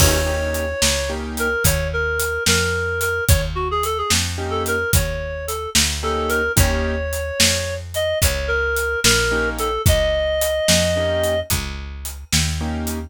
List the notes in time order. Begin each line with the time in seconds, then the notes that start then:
0.00 D#2 A#3 C#4 D#4 G4 C#5, kick, crash
0.27 A#3 C#4 D#4 G4
0.54 closed hi-hat
0.82 C#2, snare
1.09 A#3 C#4 D#4 G4
1.37 A#4, closed hi-hat
1.64 D#2 C#5, kick, closed hi-hat
1.93 A#4
2.20 closed hi-hat
2.46 F2 A#4, snare
3.01 A#4, closed hi-hat
3.29 D#2 C#5, kick, closed hi-hat
3.55 F#4
3.71 G#4
3.83 A4, closed hi-hat
3.98 G#4
4.10 F2, snare
4.38 A#3 C#4 D#4 G4
4.51 A4
4.66 A#4, closed hi-hat
4.93 D#2 C#5, kick, closed hi-hat
5.47 A4, closed hi-hat
5.75 D2, snare
6.03 A#3 C#4 D#4 G4 A4
6.29 A#4, closed hi-hat
6.57 D#2 A#3 C#4 D#4 G4 C#5, kick, closed hi-hat
7.13 closed hi-hat
7.40 F2, snare
7.94 D#5, closed hi-hat
8.22 C#2 C#5, kick, closed hi-hat
8.48 A#4
8.76 closed hi-hat
9.04 A#1 A#4, snare
9.31 A#3 C#4 D#4 G4
9.59 A4, closed hi-hat
9.86 C#2 D#5, kick, closed hi-hat
10.41 closed hi-hat
10.68 F2, snare
10.96 A#3 C#4 D#4 G4
11.24 closed hi-hat
11.50 C#2, kick, closed hi-hat
12.05 closed hi-hat
12.33 D#2, snare
12.61 A#3 C#4 D#4 G4
12.87 closed hi-hat